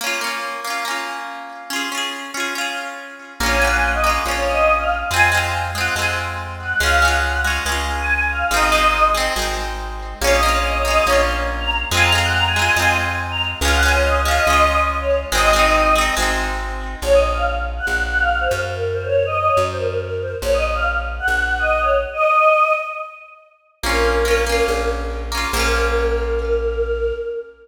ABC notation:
X:1
M:4/4
L:1/16
Q:1/4=141
K:Bbm
V:1 name="Choir Aahs"
z16 | z16 | d a g a g e z2 d2 e3 f z2 | a2 z4 g2 a z5 g2 |
f2 g4 z5 a3 f2 | e6 z10 | d e z d e d e2 d2 z3 b z2 | a b z g b a a2 a2 z3 b z2 |
f g a d e z f e3 e z2 d z2 | e6 z10 | d e z f z3 g3 g f2 c z2 | B2 c d2 e e d z c B2 B2 c z |
d e z f z3 g3 g e2 d z2 | e6 z10 | B10 z6 | B16 |]
V:2 name="Orchestral Harp"
[B,DF]2 [B,DF]4 [B,DF]2 [B,DF]8 | [DFA]2 [DFA]4 [DFA]2 [DFA]8 | [B,DF]2 [B,DF]4 [B,DF]2 [B,DF]8 | [A,CF]2 [A,CF]4 [A,CF]2 [A,CF]8 |
[A,DF]2 [A,DF]4 [A,DF]2 [A,DF]8 | [A,CE]2 [A,CE]4 [A,CE]2 [A,CE]8 | [B,DF]2 [B,DF]4 [B,DF]2 [B,DF]8 | [A,CF]2 [A,CF]4 [A,CF]2 [A,CF]8 |
[A,DF]2 [A,DF]4 [A,DF]2 [A,DF]8 | [A,CE]2 [A,CE]4 [A,CE]2 [A,CE]8 | z16 | z16 |
z16 | z16 | [B,DF]4 [B,DF]2 [B,DF]8 [B,DF]2 | [B,DF]16 |]
V:3 name="Electric Bass (finger)" clef=bass
z16 | z16 | B,,,8 B,,,8 | F,,8 F,,8 |
D,,8 D,,8 | A,,,8 A,,,8 | B,,,8 B,,,8 | F,,8 F,,8 |
D,,8 D,,8 | A,,,8 A,,,8 | B,,,8 B,,,6 G,,2- | G,,8 G,,8 |
B,,,8 B,,,8 | z16 | B,,,8 B,,,8 | B,,,16 |]